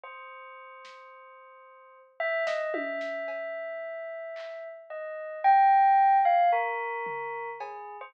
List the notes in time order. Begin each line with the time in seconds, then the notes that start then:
0.03 C5
0.85 snare
2.20 E5
2.47 D#5, snare
2.74 E5, high tom
3.01 snare
3.28 cowbell
4.36 clap
4.90 D#5
5.44 G5
6.25 F5
6.52 A#4
7.06 floor tom
7.60 G#4, cowbell
8.01 C5